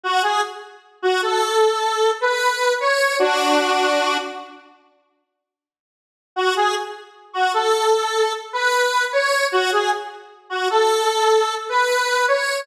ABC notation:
X:1
M:4/4
L:1/16
Q:1/4=76
K:F#m
V:1 name="Lead 1 (square)"
F G z3 F A5 B3 c2 | [DF]6 z10 | F G z3 F A5 B3 c2 | F G z3 F A5 B3 c2 |]